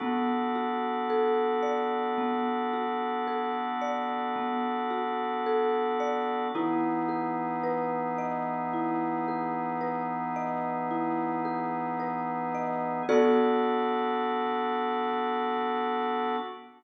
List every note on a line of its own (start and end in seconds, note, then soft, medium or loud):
0.00 6.48 B3 loud
0.00 2.17 B3 medium
0.00 6.48 D4 medium
0.00 6.48 F#4 medium
0.00 6.48 A4 medium
0.55 2.73 F#4 medium
1.10 3.27 A4 medium
1.62 3.81 D5 medium
2.18 4.35 B3 medium
2.73 4.90 F#4 medium
3.27 5.46 A4 medium
3.81 6.00 D5 medium
4.36 6.43 B3 medium
4.90 6.46 F#4 medium
5.46 6.50 A4 medium
6.00 6.52 D5 medium
6.55 13.03 E3 medium
6.55 13.03 B3 loud
6.55 13.03 D#4 loud
6.55 8.73 E4 medium
6.55 13.03 G#4 loud
7.09 9.27 G#4 medium
7.63 9.80 B4 medium
8.18 10.36 D#5 medium
8.73 10.90 E4 medium
9.28 11.45 G#4 medium
9.81 11.99 B4 medium
10.36 12.54 D#5 medium
10.91 12.98 E4 medium
11.45 13.00 G#4 medium
12.00 13.03 B4 medium
12.55 13.06 D#5 medium
13.09 16.36 B3 medium
13.09 16.36 B3 loud
13.09 16.36 D4 loud
13.09 16.36 F#4 loud
13.09 16.36 A4 loud
13.09 16.36 D5 loud